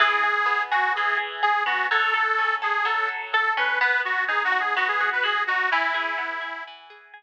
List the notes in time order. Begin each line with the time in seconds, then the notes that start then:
0.00 E3 G#4
0.23 G#4
0.46 B3
0.71 F#4 G#4
0.95 E3 G#4
1.17 G#4
1.43 G#4
1.66 B3 F#4
1.91 F#3 A4
2.14 A4
2.38 C#4
2.62 G#4 A4
2.85 F#3 A4
3.08 A4
3.33 A4
3.57 C#4 B4
3.81 B3 B4
4.05 F#4
4.28 D#4 G#4
4.45 F#4
4.52 F#4
4.60 G#4
4.76 B3 F#4
4.88 G#4
5.00 F#4
5.12 B4
5.23 F#4 G#4
5.47 D#4 F#4
5.71 E3 E4
5.94 G#4
6.18 B3
6.41 G#4
6.67 E3
6.90 G#4
7.14 G#4